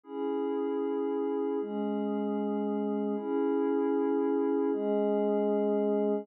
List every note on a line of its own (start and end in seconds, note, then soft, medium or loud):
0.04 1.58 C#4 medium
0.04 1.58 E4 medium
0.04 1.58 G#4 medium
1.60 3.14 G#3 medium
1.60 3.14 C#4 medium
1.60 3.14 G#4 medium
3.16 4.70 C#4 loud
3.16 4.70 E4 loud
3.16 4.70 G#4 medium
4.71 6.26 G#3 loud
4.71 6.26 C#4 medium
4.71 6.26 G#4 loud